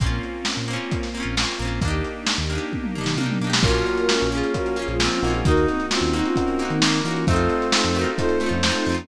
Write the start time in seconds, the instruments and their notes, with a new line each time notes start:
0.00 synth bass 1 A#1, acoustic guitar (steel) A#3 C4 C#4, string ensemble 1 A#3 C4 C#4 F4, kick, closed hi-hat
0.06 acoustic guitar (steel) F4
0.23 closed hi-hat
0.45 snare
0.57 synth bass 1 A#2
0.68 acoustic guitar (steel) A#3 C4, closed hi-hat
0.73 acoustic guitar (steel) C#4 F4
0.91 kick, closed hi-hat
1.03 snare
1.14 acoustic guitar (steel) A#3 C4, closed hi-hat
1.20 acoustic guitar (steel) C#4 F4
1.24 synth bass 1 A#1
1.37 acoustic guitar (steel) A#3 C4, snare
1.42 acoustic guitar (steel) C#4 F4
1.58 synth bass 1 A#1, acoustic guitar (steel) A#3, closed hi-hat
1.62 acoustic guitar (steel) C4 C#4
1.67 acoustic guitar (steel) F4
1.81 synth bass 1 D#2, string ensemble 1 A#3 D4 D#4 G4, acoustic guitar (steel) A#3 D4, kick, closed hi-hat
1.88 acoustic guitar (steel) D#4 G4
2.04 closed hi-hat
2.27 snare
2.38 synth bass 1 D#2
2.50 acoustic guitar (steel) A#3 D4, closed hi-hat
2.55 acoustic guitar (steel) D#4 G4
2.72 kick, high tom
2.84 mid tom
2.95 acoustic guitar (steel) A#3 D4, floor tom
3.01 acoustic guitar (steel) D#4 G4
3.06 synth bass 1 D#3, snare
3.17 synth bass 1 C3, acoustic guitar (steel) A#3 D4, high tom
3.23 acoustic guitar (steel) D#4 G4
3.30 mid tom
3.41 synth bass 1 B2, acoustic guitar (steel) A#3 D4
3.47 acoustic guitar (steel) D#4 G4
3.53 snare
3.62 synth bass 1 A#1, electric piano 1 A#3 C#4 F4, string ensemble 1 A#3 C#4 F4, acoustic guitar (steel) A#3, brass section F4, ocarina F#4 A#4, kick, crash
3.67 acoustic guitar (steel) C#4 F4
3.74 closed hi-hat
3.86 closed hi-hat
3.98 closed hi-hat
4.09 brass section C#4, snare
4.20 synth bass 1 A#1, closed hi-hat
4.32 acoustic guitar (steel) A#3 C#4, ocarina F4 G#4, closed hi-hat
4.37 acoustic guitar (steel) F4
4.43 closed hi-hat
4.54 string ensemble 1 F3 A#3 F4, electric piano 1 A#3 C#4 F4, ocarina F#4 A#4, kick, closed hi-hat
4.66 closed hi-hat
4.76 acoustic guitar (steel) A#3 C#4, ocarina F4 G#4, closed hi-hat
4.82 acoustic guitar (steel) F4
4.88 synth bass 1 A#1, ocarina F4 G#4, closed hi-hat
4.99 acoustic guitar (steel) A#3 C#4, brass section C4, snare
5.05 acoustic guitar (steel) F4
5.12 ocarina C#4 F4, closed hi-hat
5.22 synth bass 1 A#1, electric piano 1 A#3 D#4 F#4, acoustic guitar (steel) A#3, closed hi-hat
5.27 acoustic guitar (steel) C#4 F4
5.33 ocarina F4 G#4, closed hi-hat
5.45 synth bass 1 D#2, acoustic guitar (steel) A#3 D#4, string ensemble 1 A#3 D#4 F#4, brass section D#4, ocarina F#4 A#4, kick, closed hi-hat
5.51 acoustic guitar (steel) F#4
5.57 closed hi-hat
5.68 ocarina C4 D#4, closed hi-hat
5.80 closed hi-hat
5.91 brass section C4, ocarina C#4 F4, snare
6.01 synth bass 1 D#2, closed hi-hat
6.13 acoustic guitar (steel) A#3 D#4, ocarina C4 D#4, closed hi-hat
6.19 acoustic guitar (steel) F#4
6.24 ocarina C#4 F4, closed hi-hat
6.36 string ensemble 1 A#3 F#4 A#4, electric piano 1 A#3 D#4 F#4, kick, closed hi-hat
6.48 closed hi-hat
6.59 acoustic guitar (steel) A#3 D#4, closed hi-hat
6.65 acoustic guitar (steel) F#4
6.70 synth bass 1 D#3, ocarina C4 D#4, closed hi-hat
6.81 synth bass 1 D#3, acoustic guitar (steel) A#3 D#4, brass section A#3, snare
6.87 acoustic guitar (steel) F#4
6.93 closed hi-hat
7.04 synth bass 1 E3, acoustic guitar (steel) A#3 D#4, ocarina C#4 F4, closed hi-hat
7.11 acoustic guitar (steel) F#4
7.16 closed hi-hat
7.27 synth bass 1 F2, electric piano 1 A3 C4 D#4 F4, acoustic guitar (steel) A3 C4, string ensemble 1 C4 D#4 F4 A4, brass section C4, ocarina F4 A4, kick, closed hi-hat
7.33 acoustic guitar (steel) D#4 F4
7.39 closed hi-hat
7.50 closed hi-hat
7.62 closed hi-hat
7.72 snare
7.84 synth bass 1 F2, closed hi-hat
7.95 acoustic guitar (steel) A3 C4, ocarina F#4 A#4, closed hi-hat
8.01 acoustic guitar (steel) D#4 F4
8.06 closed hi-hat
8.17 electric piano 1 A3 C4 D#4 F4, ocarina F4 A4, brass section C5, kick, closed hi-hat
8.29 closed hi-hat
8.40 acoustic guitar (steel) A3 C4, ocarina C#4 F4, closed hi-hat
8.46 acoustic guitar (steel) D#4 F4
8.51 synth bass 1 F2, ocarina C#4 F4, closed hi-hat
8.63 acoustic guitar (steel) A3 C4, snare
8.69 acoustic guitar (steel) D#4 F4
8.75 ocarina C4 D#4, closed hi-hat
8.86 synth bass 1 F2, acoustic guitar (steel) A3 C4, closed hi-hat
8.92 acoustic guitar (steel) D#4 F4
8.98 ocarina A#3 C#4, closed hi-hat